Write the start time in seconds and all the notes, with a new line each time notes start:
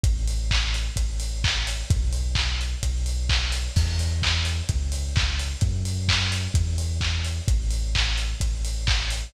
0.03 A1, kick, closed hi-hat
0.28 open hi-hat
0.51 kick, clap
0.74 open hi-hat
0.96 A1, kick, closed hi-hat
1.20 open hi-hat
1.44 kick, clap
1.67 open hi-hat
1.90 B1, kick, closed hi-hat
2.13 open hi-hat
2.35 kick, clap
2.61 open hi-hat
2.83 B1, kick, closed hi-hat
3.06 open hi-hat
3.29 kick, clap
3.52 open hi-hat
3.76 E2, kick, crash
3.99 open hi-hat
4.22 kick, clap
4.45 open hi-hat
4.69 C#2, kick, closed hi-hat
4.92 open hi-hat
5.16 kick, clap
5.39 open hi-hat
5.61 F#2, kick, closed hi-hat
5.85 open hi-hat
6.08 kick, clap
6.32 open hi-hat
6.54 E2, kick, closed hi-hat
6.78 open hi-hat
7.01 kick, clap
7.25 open hi-hat
7.48 A1, kick, closed hi-hat
7.71 open hi-hat
7.95 kick, clap
8.18 open hi-hat
8.40 A1, kick, closed hi-hat
8.65 open hi-hat
8.87 kick, clap
9.10 open hi-hat